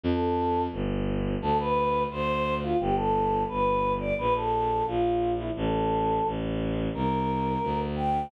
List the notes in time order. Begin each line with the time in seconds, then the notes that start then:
0.03 F2 A4
0.72 G1
1.42 D2 A4
1.59 B4
2.10 D2 C5
2.63 F4
2.80 G1 G4
2.96 A4
3.48 G1 B4
3.99 D5
4.18 A#1 B4
4.35 A4
4.86 A#1 F4
5.38 E4
5.56 A1 A4
6.25 A1
6.94 C2 A#4
7.63 D2
7.96 G5